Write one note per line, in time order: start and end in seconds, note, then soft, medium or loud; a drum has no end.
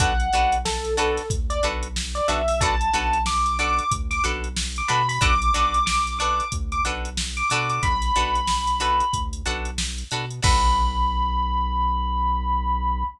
0.00 0.30 B1 medium
0.00 0.14 D4 loud
0.00 0.14 F#4 loud
0.00 0.14 A4 loud
0.00 0.14 B4 loud
0.00 0.54 F#5 loud
0.00 kick loud
0.00 closed hi-hat medium
0.20 closed hi-hat medium
0.33 1.20 B1 medium
0.33 0.58 D4 loud
0.33 0.58 F#4 medium
0.33 0.58 A4 loud
0.33 0.58 B4 loud
0.33 closed hi-hat medium
0.52 closed hi-hat medium
0.65 0.94 A4 loud
0.65 snare medium
0.85 closed hi-hat medium
0.97 1.22 D4 loud
0.97 1.22 F#4 loud
0.97 1.26 A4 loud
0.97 1.22 A4 loud
0.97 1.22 B4 loud
0.97 closed hi-hat medium
1.17 snare soft
1.17 closed hi-hat medium
1.30 1.60 D2 medium
1.30 kick medium
1.30 closed hi-hat medium
1.50 1.62 D5 loud
1.50 closed hi-hat medium
1.63 2.21 B1 medium
1.63 1.88 D4 loud
1.63 1.88 F#4 loud
1.63 1.88 A4 loud
1.63 1.88 B4 loud
1.63 closed hi-hat medium
1.83 closed hi-hat medium
1.96 snare medium
2.15 2.27 D5 loud
2.15 closed hi-hat medium
2.28 2.90 B1 medium
2.28 2.42 D4 loud
2.28 2.42 F#4 loud
2.28 2.42 A4 medium
2.28 2.42 B4 loud
2.28 2.47 E5 loud
2.28 closed hi-hat medium
2.48 2.60 E5 loud
2.48 open hi-hat medium
2.61 2.75 D4 loud
2.61 2.75 F#4 loud
2.61 2.75 A4 loud
2.61 2.75 B4 loud
2.61 3.21 A5 loud
2.61 kick medium
2.61 closed hi-hat medium
2.81 closed hi-hat medium
2.93 3.81 B1 medium
2.93 3.18 D4 loud
2.93 3.18 F#4 loud
2.93 3.18 A4 loud
2.93 3.18 B4 loud
2.93 snare soft
2.93 closed hi-hat medium
3.13 closed hi-hat medium
3.26 3.58 D6 loud
3.26 snare medium
3.46 closed hi-hat medium
3.59 3.84 D4 loud
3.59 3.84 F#4 medium
3.59 3.84 A4 medium
3.59 3.84 B4 medium
3.59 3.90 D6 loud
3.59 closed hi-hat medium
3.79 closed hi-hat medium
3.91 4.21 D2 medium
3.91 kick medium
3.91 closed hi-hat loud
4.11 4.23 D6 loud
4.11 snare soft
4.11 closed hi-hat medium
4.24 4.82 B1 medium
4.24 4.49 D4 loud
4.24 4.49 F#4 loud
4.24 4.49 A4 loud
4.24 4.49 B4 loud
4.24 closed hi-hat medium
4.44 closed hi-hat medium
4.57 snare loud
4.76 4.90 D6 loud
4.76 closed hi-hat medium
4.88 5.19 B2 medium
4.88 5.02 D4 loud
4.88 5.02 F#4 loud
4.88 5.02 A4 loud
4.88 5.02 B4 medium
4.88 5.07 B5 loud
4.88 closed hi-hat medium
5.09 5.21 B5 loud
5.09 open hi-hat medium
5.21 5.51 B1 loud
5.21 5.35 D4 loud
5.21 5.35 F#4 loud
5.21 5.35 A4 loud
5.21 5.35 B4 loud
5.21 5.84 D6 loud
5.21 kick medium
5.21 closed hi-hat medium
5.42 closed hi-hat medium
5.54 6.42 B1 medium
5.54 5.79 D4 loud
5.54 5.79 F#4 medium
5.54 5.79 A4 loud
5.54 5.79 B4 loud
5.54 closed hi-hat medium
5.74 closed hi-hat medium
5.86 6.14 D6 loud
5.86 snare medium
6.07 closed hi-hat medium
6.19 6.45 D4 loud
6.19 6.45 F#4 loud
6.19 6.45 A4 loud
6.19 6.45 B4 medium
6.19 6.48 D6 loud
6.19 closed hi-hat medium
6.40 closed hi-hat medium
6.52 6.82 D2 medium
6.52 kick medium
6.52 closed hi-hat medium
6.72 6.84 D6 medium
6.72 closed hi-hat medium
6.85 7.43 B1 medium
6.85 7.10 D4 loud
6.85 7.10 F#4 medium
6.85 7.10 A4 loud
6.85 7.10 B4 medium
6.85 closed hi-hat medium
7.05 closed hi-hat medium
7.17 snare medium
7.37 7.49 D6 loud
7.37 closed hi-hat medium
7.50 7.80 B2 medium
7.50 7.98 D4 loud
7.50 7.98 F#4 loud
7.50 7.98 A4 loud
7.50 7.98 B4 loud
7.50 7.68 D6 loud
7.50 closed hi-hat medium
7.70 7.82 D6 loud
7.70 closed hi-hat medium
7.83 8.12 B1 medium
7.83 9.20 B5 loud
7.83 kick medium
7.83 closed hi-hat medium
8.02 snare soft
8.02 closed hi-hat medium
8.16 9.03 B1 medium
8.16 8.41 D4 loud
8.16 8.41 F#4 medium
8.16 8.41 A4 loud
8.16 8.41 B4 loud
8.16 closed hi-hat medium
8.35 closed hi-hat medium
8.47 snare medium
8.67 closed hi-hat medium
8.80 9.05 D4 loud
8.80 9.05 F#4 loud
8.80 9.05 A4 loud
8.80 9.05 B4 loud
8.80 closed hi-hat medium
9.00 closed hi-hat medium
9.13 9.43 D2 medium
9.13 kick medium
9.13 closed hi-hat medium
9.33 closed hi-hat medium
9.46 10.04 B1 medium
9.46 9.71 D4 medium
9.46 9.71 F#4 loud
9.46 9.71 A4 loud
9.46 9.71 B4 medium
9.46 closed hi-hat medium
9.65 closed hi-hat medium
9.78 snare loud
9.98 closed hi-hat medium
10.11 10.41 B2 medium
10.11 10.26 D4 loud
10.11 10.26 F#4 medium
10.11 10.26 A4 loud
10.11 10.26 B4 loud
10.11 closed hi-hat medium
10.31 closed hi-hat medium
10.43 13.04 B1 loud
10.43 13.02 D4 medium
10.43 13.02 F#4 medium
10.43 13.02 A4 loud
10.43 13.02 B4 loud
10.43 13.03 B5 loud
10.43 kick loud
10.43 crash loud